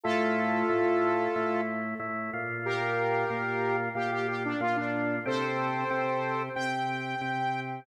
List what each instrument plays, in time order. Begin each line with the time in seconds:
0.04 drawbar organ A2 A3 E4, lead 2 (sawtooth) F4 A4
0.69 drawbar organ A2 A3 E4
1.36 drawbar organ A2 A3 E4
2.00 drawbar organ A2 A3 E4
2.33 drawbar organ A#2 A#3 F4
2.65 lead 2 (sawtooth) G4 A#4
3.30 drawbar organ A#2 A#3 F4
3.95 drawbar organ A#2 A#3 F4, lead 2 (sawtooth) G4
4.12 lead 2 (sawtooth) G4
4.28 lead 2 (sawtooth) G4
4.45 lead 2 (sawtooth) D4
4.61 drawbar organ A#2 A#3 F4, lead 2 (sawtooth) F4
4.76 lead 2 (sawtooth) D4
5.26 drawbar organ C3 C4 G4, lead 2 (sawtooth) A4 C5
5.90 drawbar organ C3 C4 G4
6.55 drawbar organ C3 C4 G4, lead 2 (sawtooth) G5
7.21 drawbar organ C3 C4 G4